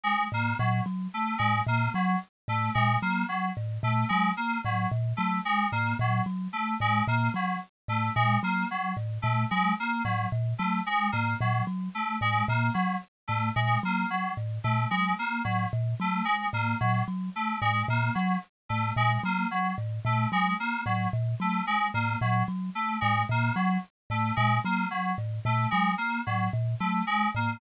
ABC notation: X:1
M:3/4
L:1/8
Q:1/4=111
K:none
V:1 name="Kalimba" clef=bass
z A,, ^A,, ^F, z =A,, | ^A,, ^F, z =A,, ^A,, F, | z A,, ^A,, ^F, z =A,, | ^A,, ^F, z =A,, ^A,, F, |
z A,, ^A,, ^F, z =A,, | ^A,, ^F, z =A,, ^A,, F, | z A,, ^A,, ^F, z =A,, | ^A,, ^F, z =A,, ^A,, F, |
z A,, ^A,, ^F, z =A,, | ^A,, ^F, z =A,, ^A,, F, | z A,, ^A,, ^F, z =A,, | ^A,, ^F, z =A,, ^A,, F, |
z A,, ^A,, ^F, z =A,, | ^A,, ^F, z =A,, ^A,, F, | z A,, ^A,, ^F, z =A,, | ^A,, ^F, z =A,, ^A,, F, |
z A,, ^A,, ^F, z =A,, |]
V:2 name="Electric Piano 2"
^G, ^A, ^F, z =A, G, | ^A, ^F, z =A, ^G, ^A, | ^F, z A, ^G, ^A, F, | z A, ^G, ^A, ^F, z |
A, ^G, ^A, ^F, z =A, | ^G, ^A, ^F, z =A, G, | ^A, ^F, z =A, ^G, ^A, | ^F, z A, ^G, ^A, F, |
z A, ^G, ^A, ^F, z | A, ^G, ^A, ^F, z =A, | ^G, ^A, ^F, z =A, G, | ^A, ^F, z =A, ^G, ^A, |
^F, z A, ^G, ^A, F, | z A, ^G, ^A, ^F, z | A, ^G, ^A, ^F, z =A, | ^G, ^A, ^F, z =A, G, |
^A, ^F, z =A, ^G, ^A, |]